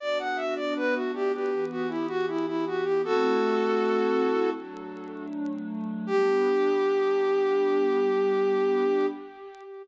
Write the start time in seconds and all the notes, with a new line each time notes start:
0.00 B3 D4 F#4 D5
0.19 F#5
0.36 E5
0.56 D5
0.76 B4
0.94 F#4
1.14 G4
1.34 G4
1.52 E3 B3 G4
1.71 F#4
1.89 E4
2.08 F#4
2.28 E4
2.47 E4
2.66 F#4
2.83 G4
3.03 A3 C4 E4 F#4 A4
4.55 F#3 A3 D4
6.07 G3 B3 D4 G4